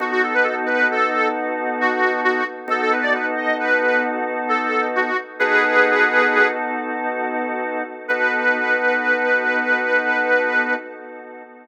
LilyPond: <<
  \new Staff \with { instrumentName = "Harmonica" } { \time 12/8 \key b \major \tempo 4. = 89 fis'16 fis'16 a'16 b'16 a'16 r16 b'8 a'4 r4 fis'4 fis'8 r8 | a'16 a'16 b'16 d''16 b'16 r16 dis''8 b'4 r4 a'4 fis'8 r8 | <gis' b'>2~ <gis' b'>8 r2. r8 | b'1. | }
  \new Staff \with { instrumentName = "Drawbar Organ" } { \time 12/8 \key b \major <b dis' fis' a'>1. | <b dis' fis' a'>1. | <b dis' fis' a'>1. | <b dis' fis' a'>1. | }
>>